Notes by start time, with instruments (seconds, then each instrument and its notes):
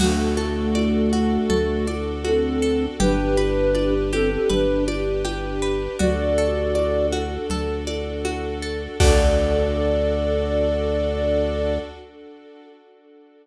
0.00 synth bass 2 D2, ocarina A3 F#4, string ensemble 1 D4 F#4 A4, orchestral harp F#4, crash, low conga
0.37 orchestral harp A4, high conga
0.75 orchestral harp D5, high conga
1.13 orchestral harp F#4, high conga
1.50 synth bass 2 D2, orchestral harp A4, low conga
1.87 orchestral harp D5, high conga
2.25 ocarina C4 A4, orchestral harp F#4, high conga
2.62 orchestral harp A4
3.00 synth bass 2 G1, string ensemble 1 D4 G4 B4, ocarina D4 B4, orchestral harp G4, low conga
3.37 orchestral harp B4, high conga
3.75 orchestral harp D5, high conga
4.12 ocarina C4 A4, orchestral harp G4, high conga
4.31 ocarina C4 A4
4.50 synth bass 2 G1, ocarina D4 B4, orchestral harp B4, low conga
4.88 orchestral harp D5, high conga
5.25 orchestral harp G4, high conga
5.62 orchestral harp B4
5.99 synth bass 2 D2, string ensemble 1 D4 F#4 A4, orchestral harp F#4, ocarina F#4 D5, low conga
6.38 orchestral harp A4
6.75 orchestral harp D5, high conga
7.12 orchestral harp F#4, high conga
7.50 synth bass 2 D2, orchestral harp A4, low conga
7.87 orchestral harp D5, high conga
8.25 orchestral harp F#4, high conga
8.62 orchestral harp A4
9.00 synth bass 2 D2, string ensemble 1 D4 F#4 A4, orchestral harp F#4 A4 D5, ocarina D5, kick, crash